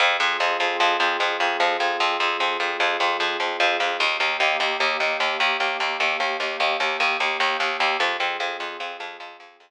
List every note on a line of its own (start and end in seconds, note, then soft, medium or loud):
0.00 0.17 F2 medium
0.00 3.96 C4 medium
0.00 3.96 F4 medium
0.00 3.96 G#4 medium
0.20 0.37 F2 medium
0.40 0.57 F2 medium
0.60 0.77 F2 medium
0.80 0.97 F2 medium
1.00 1.17 F2 medium
1.20 1.37 F2 medium
1.40 1.57 F2 medium
1.60 1.77 F2 medium
1.80 1.97 F2 medium
2.00 2.17 F2 medium
2.20 2.37 F2 medium
2.40 2.57 F2 medium
2.60 2.77 F2 medium
2.80 2.97 F2 medium
3.00 3.17 F2 medium
3.20 3.37 F2 medium
3.40 3.57 F2 medium
3.60 3.77 F2 medium
3.80 3.97 F2 medium
4.00 4.17 D#2 medium
4.00 7.96 A#3 medium
4.00 7.96 D#4 medium
4.00 7.96 G4 medium
4.20 4.37 D#2 medium
4.40 4.57 D#2 medium
4.60 4.77 D#2 medium
4.80 4.97 D#2 medium
5.00 5.17 D#2 medium
5.20 5.37 D#2 medium
5.40 5.57 D#2 medium
5.60 5.77 D#2 medium
5.80 5.97 D#2 medium
6.00 6.17 D#2 medium
6.20 6.37 D#2 medium
6.40 6.57 D#2 medium
6.60 6.77 D#2 medium
6.80 6.97 D#2 medium
7.00 7.17 D#2 medium
7.20 7.37 D#2 medium
7.40 7.57 D#2 medium
7.60 7.77 D#2 medium
7.80 7.97 D#2 medium
8.00 8.17 F2 medium
8.00 9.70 C4 medium
8.00 9.70 F4 medium
8.00 9.70 G#4 medium
8.20 8.37 F2 medium
8.40 8.57 F2 medium
8.60 8.77 F2 medium
8.80 8.97 F2 medium
9.00 9.17 F2 medium
9.20 9.37 F2 medium
9.40 9.57 F2 medium
9.60 9.70 F2 medium